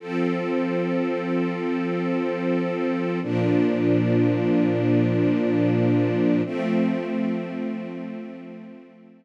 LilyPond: \new Staff { \time 5/4 \key f \major \tempo 4 = 93 <f c' a'>1~ <f c' a'>4 | <bes, f d'>1~ <bes, f d'>4 | <f a c'>1~ <f a c'>4 | }